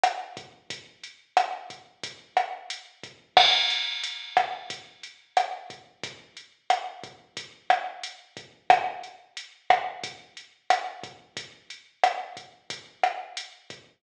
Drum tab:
CC |--|--------|x-------|--------|
HH |xx|xxxxxxxx|-xxxxxxx|xxxxxxxx|
SD |r-|--r--r--|r--r--r-|--r--r--|
BD |-o|o--oo--o|o--oo--o|o--oo--o|

CC |--------|--------|
HH |xxxxxxxx|xxxxxxxx|
SD |r--r--r-|--r--r--|
BD |o--oo--o|o--oo--o|